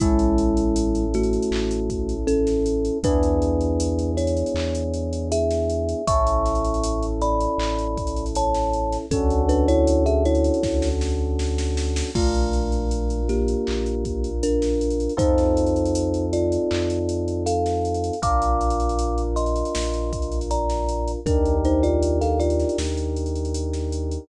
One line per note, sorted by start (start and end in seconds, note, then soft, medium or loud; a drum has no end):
0.00 1.39 A1 loud
0.00 1.05 G#3 loud
0.00 2.99 C#4 medium
0.00 1.05 E4 loud
0.00 2.99 E4 medium
0.00 2.99 A4 medium
0.00 kick loud
0.00 closed hi-hat loud
0.19 closed hi-hat medium
0.38 closed hi-hat medium
0.57 closed hi-hat medium
0.76 closed hi-hat loud
0.95 closed hi-hat medium
1.14 2.15 A3 medium
1.14 2.15 F#4 loud
1.14 closed hi-hat medium
1.23 closed hi-hat medium
1.33 closed hi-hat medium
1.42 closed hi-hat medium
1.51 2.91 A1 medium
1.51 clap loud
1.71 closed hi-hat medium
1.90 kick medium
1.90 closed hi-hat medium
2.09 closed hi-hat medium
2.27 2.98 C#4 loud
2.27 2.98 A4 loud
2.27 closed hi-hat medium
2.47 snare medium
2.47 closed hi-hat medium
2.66 closed hi-hat medium
2.85 closed hi-hat medium
3.03 4.43 E2 loud
3.03 6.02 B3 medium
3.03 6.02 D4 medium
3.03 4.11 D4 loud
3.03 6.02 E4 medium
3.03 6.02 G#4 medium
3.03 4.11 B4 loud
3.03 kick loud
3.03 closed hi-hat loud
3.23 closed hi-hat medium
3.42 closed hi-hat medium
3.61 closed hi-hat medium
3.80 closed hi-hat loud
3.99 closed hi-hat medium
4.17 5.28 E4 medium
4.17 5.28 C#5 loud
4.17 closed hi-hat medium
4.27 closed hi-hat medium
4.37 closed hi-hat medium
4.46 closed hi-hat medium
4.54 5.94 E2 medium
4.54 clap loud
4.75 closed hi-hat medium
4.94 closed hi-hat medium
5.13 closed hi-hat medium
5.32 6.05 G#4 loud
5.32 6.05 E5 loud
5.32 closed hi-hat loud
5.50 snare medium
5.50 closed hi-hat medium
5.70 closed hi-hat medium
5.89 closed hi-hat medium
6.07 7.48 A1 loud
6.07 9.06 C#4 medium
6.07 9.06 E4 medium
6.07 9.06 A4 medium
6.07 7.06 E5 loud
6.07 7.06 C#6 loud
6.07 kick loud
6.07 closed hi-hat loud
6.27 closed hi-hat medium
6.46 snare soft
6.46 closed hi-hat medium
6.55 closed hi-hat medium
6.65 closed hi-hat medium
6.74 closed hi-hat medium
6.84 closed hi-hat loud
7.03 closed hi-hat medium
7.22 8.25 D5 medium
7.22 8.25 B5 loud
7.22 closed hi-hat medium
7.41 closed hi-hat medium
7.58 8.98 A1 medium
7.58 clap loud
7.78 closed hi-hat medium
7.97 kick medium
7.97 closed hi-hat medium
8.07 closed hi-hat medium
8.16 closed hi-hat medium
8.26 closed hi-hat medium
8.35 8.97 C#5 medium
8.35 8.97 A5 loud
8.35 closed hi-hat loud
8.54 snare medium
8.54 closed hi-hat medium
8.73 closed hi-hat medium
8.92 snare soft
8.92 closed hi-hat medium
9.11 10.50 D2 medium
9.11 9.42 C#4 medium
9.11 12.10 C#4 medium
9.11 12.10 D4 medium
9.11 12.10 F#4 loud
9.11 9.42 A4 loud
9.11 12.10 A4 medium
9.11 kick loud
9.11 closed hi-hat loud
9.30 closed hi-hat medium
9.49 9.67 D4 medium
9.49 9.67 B4 loud
9.49 closed hi-hat medium
9.68 10.04 E4 loud
9.68 10.04 C#5 loud
9.68 closed hi-hat medium
9.87 closed hi-hat loud
10.06 10.24 G#4 medium
10.06 10.24 E5 loud
10.06 closed hi-hat medium
10.25 10.89 E4 medium
10.25 10.89 C#5 loud
10.25 closed hi-hat medium
10.35 closed hi-hat medium
10.44 closed hi-hat medium
10.54 closed hi-hat medium
10.63 12.03 D2 medium
10.63 kick medium
10.63 snare medium
10.82 snare medium
11.01 snare medium
11.39 snare medium
11.58 snare medium
11.77 snare medium
11.96 snare loud
12.15 13.55 A#1 medium
12.15 13.21 A3 medium
12.15 15.13 D4 medium
12.15 15.13 F4 medium
12.15 13.21 F4 medium
12.15 15.13 A#4 medium
12.15 kick loud
12.15 crash loud
12.34 closed hi-hat medium
12.53 closed hi-hat medium
12.72 closed hi-hat medium
12.91 closed hi-hat medium
13.10 closed hi-hat medium
13.29 14.30 A#3 medium
13.29 14.30 G4 medium
13.29 snare soft
13.29 closed hi-hat medium
13.48 closed hi-hat medium
13.67 15.08 A#1 medium
13.67 clap loud
13.86 closed hi-hat medium
14.05 kick medium
14.05 closed hi-hat medium
14.24 closed hi-hat medium
14.43 15.14 D4 medium
14.43 15.14 A#4 medium
14.43 closed hi-hat loud
14.62 snare medium
14.62 closed hi-hat medium
14.81 closed hi-hat medium
14.91 closed hi-hat medium
15.00 closed hi-hat medium
15.09 closed hi-hat medium
15.17 16.58 F2 medium
15.17 18.15 C4 medium
15.17 18.15 D#4 medium
15.17 16.25 D#4 medium
15.17 18.15 F4 medium
15.17 18.15 A4 medium
15.17 16.25 C5 loud
15.17 kick loud
15.17 closed hi-hat loud
15.38 snare soft
15.38 closed hi-hat medium
15.57 closed hi-hat medium
15.66 closed hi-hat medium
15.76 closed hi-hat medium
15.85 closed hi-hat medium
15.95 closed hi-hat loud
16.14 closed hi-hat medium
16.33 17.44 F4 medium
16.33 17.44 D5 medium
16.33 closed hi-hat medium
16.52 closed hi-hat medium
16.71 18.11 F2 medium
16.71 clap loud
16.90 snare soft
16.90 closed hi-hat medium
17.09 closed hi-hat medium
17.28 closed hi-hat medium
17.46 18.20 A4 medium
17.46 18.20 F5 medium
17.46 closed hi-hat loud
17.66 snare medium
17.66 closed hi-hat medium
17.85 closed hi-hat medium
17.94 closed hi-hat medium
18.04 closed hi-hat medium
18.13 closed hi-hat medium
18.22 19.63 A#1 medium
18.22 21.20 D4 medium
18.22 21.20 F4 medium
18.22 21.20 A#4 medium
18.22 19.22 F5 medium
18.22 19.22 D6 loud
18.22 kick loud
18.22 closed hi-hat loud
18.42 closed hi-hat medium
18.61 closed hi-hat medium
18.70 closed hi-hat medium
18.80 closed hi-hat medium
18.89 closed hi-hat medium
18.99 closed hi-hat loud
19.18 closed hi-hat medium
19.36 20.39 D#5 medium
19.36 20.39 C6 medium
19.36 closed hi-hat medium
19.46 closed hi-hat medium
19.56 closed hi-hat medium
19.65 closed hi-hat medium
19.75 21.15 A#1 medium
19.75 snare loud
19.94 closed hi-hat medium
20.13 kick medium
20.13 closed hi-hat medium
20.22 closed hi-hat medium
20.32 closed hi-hat medium
20.41 closed hi-hat medium
20.51 21.12 D5 medium
20.51 21.12 A#5 medium
20.51 closed hi-hat medium
20.70 snare medium
20.70 closed hi-hat medium
20.89 closed hi-hat medium
21.08 closed hi-hat medium
21.26 22.65 D#2 medium
21.26 21.57 D4 medium
21.26 24.24 D4 medium
21.26 24.24 D#4 medium
21.26 24.24 G4 medium
21.26 21.57 A#4 medium
21.26 24.24 A#4 medium
21.26 kick loud
21.26 closed hi-hat medium
21.45 closed hi-hat medium
21.65 21.83 D#4 medium
21.65 21.83 C5 medium
21.65 closed hi-hat medium
21.83 22.19 F4 medium
21.83 22.19 D5 loud
21.83 closed hi-hat medium
22.03 closed hi-hat medium
22.21 22.39 A4 medium
22.21 22.39 F5 medium
22.21 snare soft
22.21 closed hi-hat medium
22.40 22.78 F4 medium
22.40 22.78 D5 medium
22.40 closed hi-hat medium
22.50 closed hi-hat medium
22.59 snare soft
22.59 closed hi-hat medium
22.69 closed hi-hat medium
22.78 24.18 D#2 medium
22.78 snare loud
22.97 closed hi-hat medium
23.16 closed hi-hat medium
23.26 closed hi-hat medium
23.35 closed hi-hat medium
23.45 closed hi-hat medium
23.54 closed hi-hat loud
23.73 snare medium
23.73 closed hi-hat medium
23.92 closed hi-hat medium
24.11 closed hi-hat medium